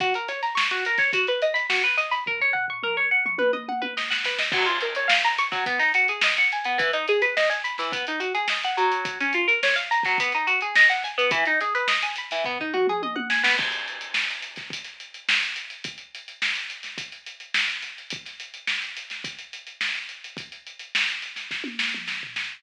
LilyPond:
<<
  \new Staff \with { instrumentName = "Pizzicato Strings" } { \time 4/4 \key fis \mixolydian \tempo 4 = 106 fis'16 ais'16 cis''16 ais''16 cis'''16 fis'16 ais'16 cis''16 fis'16 b'16 dis''16 b''16 fis'16 b'16 dis''16 b''16 | ais'16 cis''16 fis''16 cis'''16 ais'16 cis''16 fis''16 cis'''16 b'16 dis''16 fis''16 b'16 dis''16 fis''16 b'16 dis''16 | fis16 eis'16 ais'16 cis''16 eis''16 ais''16 cis'''16 fis16 b16 dis'16 fis'16 gis'16 dis''16 fis''16 gis''16 b16 | e16 dis'16 gis'16 b'16 dis''16 gis''16 b''16 e16 b16 dis'16 fis'16 gis'16 dis''16 fis''16 fis8~ |
fis16 cis'16 eis'16 ais'16 cis''16 eis''16 ais''16 fis16 b16 dis'16 fis'16 gis'16 dis''16 fis''16 gis''16 b16 | e16 dis'16 gis'16 b'16 dis''16 gis''16 b''16 e16 b16 dis'16 fis'16 gis'16 dis''16 fis''16 gis''16 b16 | r1 | r1 |
r1 | r1 | }
  \new DrumStaff \with { instrumentName = "Drums" } \drummode { \time 4/4 <hh bd>16 hh16 <hh sn>16 <hh sn>16 sn16 hh16 hh16 <hh bd sn>16 <hh bd>16 hh16 hh16 <hh sn>16 sn16 hh16 <hh sn>16 hh16 | <bd tomfh>16 tomfh16 tomfh16 tomfh16 toml8. toml16 tommh16 tommh16 tommh16 tommh16 sn16 sn16 sn16 sn16 | <cymc bd>16 hh16 hh16 hh16 sn16 <hh sn>16 hh16 <hh bd sn>16 <hh bd>16 <hh sn>16 hh16 hh16 sn16 hh16 hh16 hh16 | <hh bd>16 hh16 hh16 hh16 sn16 hh16 hh16 <hh sn>16 <hh bd>16 hh16 hh16 hh16 sn16 hh16 hh16 hh16 |
<hh bd>16 hh16 hh16 hh16 sn16 hh16 hh16 <hh bd sn>16 <hh bd>16 hh16 hh16 hh16 sn16 hh16 <hh sn>16 hh16 | <hh bd>16 hh16 hh16 hh16 sn16 hh16 hh16 <hh sn>16 <bd tomfh>16 tomfh16 toml16 toml16 tommh16 tommh16 sn16 sn16 | <cymc bd>16 hh16 hh16 hh16 sn16 <hh sn>16 hh16 <hh bd sn>16 <hh bd>16 <hh sn>16 hh16 hh16 sn16 hh16 hh16 hh16 | <hh bd>16 hh16 hh16 hh16 sn16 <hh sn>16 hh16 <hh sn>16 <hh bd>16 hh16 hh16 hh16 sn16 hh16 <hh sn>16 hh16 |
<hh bd>16 <hh sn>16 hh16 hh16 sn16 hh16 hh16 <hh sn>16 <hh bd>16 hh16 hh16 hh16 sn16 hh16 hh16 hh16 | <hh bd>16 hh16 hh16 hh16 sn16 hh16 <hh sn>16 <hh sn>16 <bd sn>16 tommh16 sn16 toml16 sn16 tomfh16 sn8 | }
>>